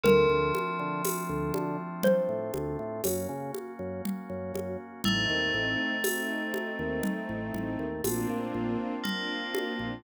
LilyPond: <<
  \new Staff \with { instrumentName = "Xylophone" } { \time 5/4 \key bes \major \tempo 4 = 60 bes'2 c''2. | r1 r4 | }
  \new Staff \with { instrumentName = "Tubular Bells" } { \time 5/4 \key bes \major f2~ f8 r2 r8 | a1 bes4 | }
  \new Staff \with { instrumentName = "String Ensemble 1" } { \time 5/4 \key bes \major r1 r4 | <a c' ees'>4 <a c' ees'>2 <bes c' d' f'>4 <bes c' d' f'>4 | }
  \new Staff \with { instrumentName = "Drawbar Organ" } { \clef bass \time 5/4 \key bes \major d,16 d,8 d8 d,16 d8. a,16 d,16 a,16 ges,16 des8 ges,8 ges,16 ges,8 | a,,16 ees,16 a,,4~ a,,16 ees,8 a,,16 a,,16 ees,16 bes,,16 bes,16 bes,,4~ bes,,16 bes,,16 | }
  \new Staff \with { instrumentName = "Drawbar Organ" } { \time 5/4 \key bes \major <a c' d' f'>2. <bes des' ges'>2 | <a c' ees'>2. <bes c' d' f'>2 | }
  \new DrumStaff \with { instrumentName = "Drums" } \drummode { \time 5/4 cgl8 cgho8 <cgho tamb>8 cgho8 cgl8 cgho8 <cgho tamb>8 cgho8 cgl8 cgho8 | cgl4 <cgho tamb>8 cgho8 cgl8 cgl8 <cgho tamb>4 cgl8 cgho8 | }
>>